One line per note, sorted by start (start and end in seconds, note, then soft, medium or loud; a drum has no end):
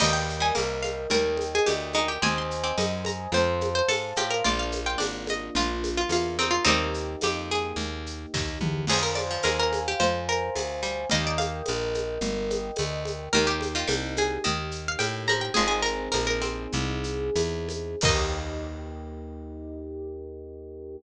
0.00 0.52 D#2 medium
0.00 0.40 G3 medium
0.00 2.18 A#4 medium
0.00 0.12 D#5 medium
0.00 2.18 D#5 medium
0.00 2.18 G5 medium
0.00 crash loud
0.00 low conga medium
0.00 shaker medium
0.13 0.39 G5 medium
0.29 shaker medium
0.40 0.53 G3 medium
0.40 0.55 G#5 medium
0.55 1.07 C2 medium
0.55 1.05 A#3 medium
0.55 tambourine medium
0.55 high conga medium
0.55 shaker medium
0.83 1.06 F5 medium
0.83 high conga medium
0.83 shaker medium
1.10 1.60 D#2 medium
1.10 1.81 G3 medium
1.10 1.47 A#4 medium
1.10 low conga medium
1.10 shaker medium
1.37 high conga medium
1.37 shaker medium
1.55 1.68 G#4 medium
1.66 2.18 D2 medium
1.66 1.89 G4 medium
1.66 tambourine medium
1.66 high conga medium
1.66 shaker medium
1.93 2.19 G#3 medium
1.93 2.08 D#4 medium
1.93 high conga medium
1.93 shaker medium
2.08 2.22 G4 medium
2.22 2.73 D#2 medium
2.22 2.56 C4 medium
2.22 3.30 C5 medium
2.22 3.30 D#5 medium
2.22 3.30 G#5 medium
2.22 2.36 G#5 medium
2.22 low conga loud
2.22 shaker medium
2.38 2.65 C6 medium
2.51 shaker medium
2.64 2.77 C4 medium
2.64 2.77 D6 medium
2.78 3.28 F#2 medium
2.78 3.31 D#4 medium
2.78 tambourine medium
2.78 high conga medium
2.78 shaker medium
3.05 3.33 A#5 medium
3.05 high conga medium
3.05 shaker medium
3.32 3.82 F2 medium
3.32 4.02 C4 medium
3.32 3.73 C5 medium
3.32 4.44 C5 medium
3.32 4.44 F5 medium
3.32 4.44 A5 medium
3.32 low conga medium
3.32 shaker medium
3.61 high conga medium
3.61 shaker medium
3.75 3.88 C5 medium
3.88 4.13 G#2 medium
3.88 4.11 A4 medium
3.88 tambourine medium
3.88 high conga medium
3.88 shaker medium
4.16 4.42 A2 medium
4.16 4.44 F4 medium
4.16 4.31 G4 medium
4.16 high conga medium
4.16 shaker medium
4.30 4.44 A#4 medium
4.44 4.96 A#1 medium
4.44 6.63 A#3 medium
4.44 6.63 D4 medium
4.44 4.80 F4 medium
4.44 6.63 F4 medium
4.44 4.59 D5 medium
4.44 low conga medium
4.44 shaker medium
4.59 4.85 F5 medium
4.72 high conga medium
4.72 shaker medium
4.86 5.00 F4 medium
4.86 4.99 G5 medium
4.98 5.50 G#1 medium
4.98 5.49 D4 medium
4.98 tambourine medium
4.98 high conga medium
4.98 shaker medium
5.27 5.54 D#5 medium
5.27 high conga medium
5.27 shaker medium
5.55 6.05 A#1 medium
5.55 6.38 F4 medium
5.55 5.94 F4 medium
5.55 low conga medium
5.55 shaker medium
5.84 high conga medium
5.84 shaker medium
5.97 6.11 F4 medium
6.09 6.59 E2 medium
6.09 6.37 F4 medium
6.09 tambourine medium
6.09 high conga medium
6.09 shaker medium
6.39 6.52 C4 medium
6.39 6.65 D#4 medium
6.39 high conga medium
6.39 shaker medium
6.51 6.64 F4 medium
6.65 7.16 D#2 medium
6.65 7.75 G3 medium
6.65 8.84 A#3 medium
6.65 7.75 A#3 medium
6.65 7.16 C4 medium
6.65 7.16 D#4 medium
6.65 8.84 D#4 medium
6.65 8.84 G4 medium
6.65 low conga loud
6.65 shaker medium
6.94 shaker medium
7.21 7.73 F2 medium
7.21 7.51 G4 medium
7.21 tambourine medium
7.21 high conga medium
7.21 shaker medium
7.51 8.54 G#4 medium
7.51 shaker medium
7.76 8.26 D#2 medium
7.76 low conga medium
7.76 shaker medium
8.06 shaker medium
8.34 8.59 D#2 medium
8.34 kick medium
8.34 snare medium
8.61 8.86 E2 medium
8.61 mid tom loud
8.87 9.38 F2 medium
8.87 9.26 F3 medium
8.87 9.03 G#4 medium
8.87 11.07 C5 medium
8.87 11.07 F5 medium
8.87 11.07 G#5 medium
8.87 crash loud
8.87 low conga medium
8.87 shaker medium
9.03 9.16 A#4 medium
9.15 9.39 D5 medium
9.15 high conga medium
9.15 shaker medium
9.31 9.44 F3 medium
9.43 9.95 D#2 medium
9.43 9.94 G#3 medium
9.43 9.57 A#4 medium
9.43 tambourine medium
9.43 high conga medium
9.43 shaker medium
9.59 9.84 A#4 medium
9.73 high conga medium
9.73 shaker medium
9.88 10.01 G4 medium
10.00 10.50 F2 medium
10.00 10.80 F3 medium
10.00 10.24 C5 medium
10.00 low conga medium
10.00 shaker medium
10.28 11.02 A#4 medium
10.28 shaker medium
10.55 11.06 D2 medium
10.55 tambourine medium
10.55 high conga medium
10.55 shaker medium
10.83 11.05 G3 medium
10.83 shaker medium
11.09 11.62 D#2 medium
11.09 11.79 G3 medium
11.09 11.79 A#3 medium
11.09 13.27 A#4 medium
11.09 13.27 D#5 medium
11.09 11.25 D#5 medium
11.09 13.27 G5 medium
11.09 low conga medium
11.09 shaker medium
11.27 11.40 D5 medium
11.38 12.07 F5 medium
11.38 high conga medium
11.38 shaker medium
11.66 12.19 A#1 medium
11.66 tambourine medium
11.66 high conga medium
11.66 shaker medium
11.94 high conga medium
11.94 shaker medium
12.21 12.71 G1 medium
12.21 low conga medium
12.21 shaker medium
12.50 high conga medium
12.50 shaker medium
12.76 13.29 D2 medium
12.76 tambourine medium
12.76 high conga medium
12.76 shaker medium
13.05 high conga medium
13.05 shaker medium
13.33 13.84 D#2 loud
13.33 13.74 D#3 loud
13.33 15.51 A#3 medium
13.33 15.51 D#4 medium
13.33 15.51 G4 medium
13.33 13.46 A#4 loud
13.33 low conga loud
13.33 shaker medium
13.47 13.73 G4 medium
13.61 high conga medium
13.61 shaker medium
13.75 13.88 D#3 medium
13.75 13.89 F4 medium
13.88 14.38 C2 medium
13.88 14.35 G3 medium
13.88 tambourine medium
13.88 high conga medium
13.88 shaker medium
14.17 14.43 G#4 medium
14.17 high conga medium
14.17 shaker medium
14.44 14.96 D#2 medium
14.44 15.20 D#3 medium
14.44 14.83 D#5 medium
14.44 low conga medium
14.44 shaker medium
14.71 shaker medium
14.88 15.01 F5 medium
14.99 15.50 A2 medium
14.99 15.24 G5 medium
14.99 tambourine medium
14.99 high conga medium
14.99 shaker medium
15.27 15.53 F3 medium
15.27 15.41 A#5 medium
15.27 high conga medium
15.27 shaker medium
15.41 15.54 G5 medium
15.54 16.09 G#1 medium
15.54 16.30 F3 medium
15.54 16.30 G#3 medium
15.54 17.98 C4 medium
15.54 17.98 D#4 medium
15.54 15.67 G#4 medium
15.54 17.98 G#4 medium
15.54 low conga loud
15.54 shaker medium
15.68 15.81 G#4 medium
15.82 16.09 A#4 medium
15.82 shaker medium
16.12 16.67 A#1 medium
16.12 16.26 A#4 medium
16.12 tambourine medium
16.12 high conga medium
16.12 shaker medium
16.27 17.65 A#4 medium
16.42 17.33 C4 medium
16.42 high conga medium
16.42 shaker medium
16.72 17.30 C2 medium
16.72 low conga medium
16.72 shaker medium
17.04 shaker medium
17.35 17.96 E2 medium
17.35 tambourine medium
17.35 high conga medium
17.35 shaker medium
17.69 high conga medium
17.69 shaker medium
18.01 20.97 D#2 loud
18.01 20.96 A#3 loud
18.01 20.96 D#4 loud
18.01 20.98 D#4 loud
18.01 20.96 G4 loud
18.01 20.98 D#5 loud
18.01 kick loud
18.01 crash loud